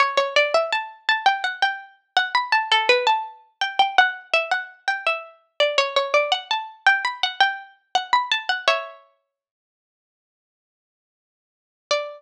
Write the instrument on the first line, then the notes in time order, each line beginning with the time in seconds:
harpsichord
0.00 C#5
0.17 C#5
0.36 D5
0.54 E5
0.72 A5
1.09 A5
1.26 G5
1.44 F#5
1.62 G5
2.17 F#5
2.35 B5
2.52 A5
2.72 A4
2.89 B4
3.07 A5
3.61 G5
3.79 G5
3.98 F#5
4.34 E5
4.51 F#5
4.88 G5
5.06 E5
5.60 D5
5.78 C#5
5.96 C#5
6.14 D5
6.32 F#5
6.51 A5
6.86 G5
7.05 B5
7.23 F#5
7.41 G5
7.95 F#5
8.13 B5
8.31 A5
8.49 F#5
8.68 C#5 E5
11.91 D5